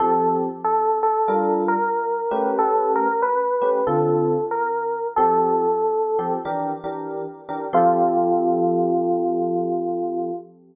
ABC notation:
X:1
M:4/4
L:1/8
Q:"Swing" 1/4=93
K:F
V:1 name="Electric Piano 1"
A z A A2 B3 | A ^A =B2 =A2 _B2 | A4 z4 | F8 |]
V:2 name="Electric Piano 1"
[F,CGA]4 [G,DFB]3 [A,^CG=B]- | [A,^CG=B]3 [A,CGB] [D,=CFA]4 | [F,CGA]3 [F,CGA] [E,DGB] [E,DGB]2 [E,DGB] | [F,CGA]8 |]